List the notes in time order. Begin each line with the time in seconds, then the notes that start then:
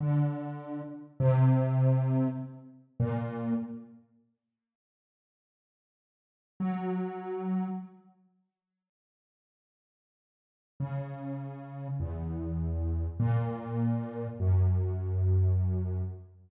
0.01 D3
1.20 C3
3.00 A#2
6.60 F#3
10.80 C#3
12.00 E2
13.20 A#2
14.40 F#2